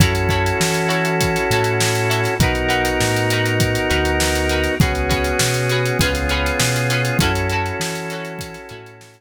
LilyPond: <<
  \new Staff \with { instrumentName = "Acoustic Guitar (steel)" } { \time 4/4 \key fis \dorian \tempo 4 = 100 <e' fis' a' cis''>8 <e' fis' a' cis''>4 <e' fis' a' cis''>4 <e' fis' a' cis''>4 <e' fis' a' cis''>8 | <dis' fis' ais' b'>8 <dis' fis' ais' b'>4 <dis' fis' ais' b'>4 <dis' fis' ais' b'>4 <dis' fis' ais' b'>8 | <cis' fis' gis' b'>8 <cis' fis' gis' b'>4 <cis' fis' gis' b'>8 <cis' eis' gis' b'>8 <cis' eis' gis' b'>4 <cis' eis' gis' b'>8 | <cis' e' fis' a'>8 <cis' e' fis' a'>4 <cis' e' fis' a'>4 <cis' e' fis' a'>4 r8 | }
  \new Staff \with { instrumentName = "Drawbar Organ" } { \time 4/4 \key fis \dorian <cis' e' fis' a'>1 | <b dis' fis' ais'>1 | <b cis' fis' gis'>2 <b cis' eis' gis'>2 | <cis' e' fis' a'>1 | }
  \new Staff \with { instrumentName = "Synth Bass 1" } { \clef bass \time 4/4 \key fis \dorian fis,4 e4. a,4. | b,,4 a,4. d,4. | cis,4 b,4 cis,4 b,4 | fis,4 e4. a,4. | }
  \new DrumStaff \with { instrumentName = "Drums" } \drummode { \time 4/4 <hh bd>16 hh16 <hh bd>16 hh16 sn16 hh16 hh16 hh16 <hh bd>16 hh16 hh16 hh16 sn16 hh16 hh16 <hh sn>16 | <hh bd>16 hh16 hh16 hh16 sn16 hh16 hh16 hh16 <hh bd>16 hh16 hh16 hh16 sn16 hh16 hh16 <hh sn>16 | <hh bd>16 hh16 <hh bd>16 hh16 sn16 <hh sn>16 hh16 hh16 <hh bd>16 <hh sn>16 hh16 hh16 sn16 hh16 <hh sn>16 hh16 | <hh bd>16 hh16 hh16 hh16 sn16 hh16 <hh sn>16 hh16 <hh bd>16 <hh sn>16 hh16 hh16 sn16 hh8. | }
>>